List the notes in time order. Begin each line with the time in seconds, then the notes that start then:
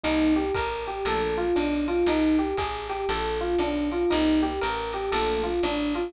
0.03 C2 G3 A#3 C4 D#4, ride
0.36 G4
0.54 A1 A#4, kick, hi-hat pedal, ride
0.86 G4, ride
1.05 A#1 F3 A3 A#3 D4 A4, ride
1.38 F4
1.56 B1 D4, hi-hat pedal, ride
1.88 F4, ride
2.06 C2 D#4, ride
2.39 G4
2.57 A1 G#4, kick, hi-hat pedal, ride
2.89 G4, ride
3.09 A#1 A4, ride
3.41 F4
3.58 B1 D4, hi-hat pedal, ride
3.92 F4, ride
4.10 C2 G3 A#3 C4 D#4, ride
4.42 G4
4.61 A1 A#4, hi-hat pedal, ride
4.93 G4, ride
5.12 A#1 F3 A3 A#3 D4 A4, ride
5.44 F4
5.63 A1 D4, hi-hat pedal, ride
5.94 F4, ride